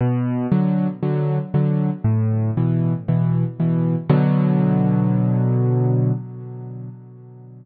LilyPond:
\new Staff { \clef bass \time 4/4 \key b \minor \tempo 4 = 117 b,4 <d fis>4 <d fis>4 <d fis>4 | a,4 <b, e>4 <b, e>4 <b, e>4 | <b, d fis>1 | }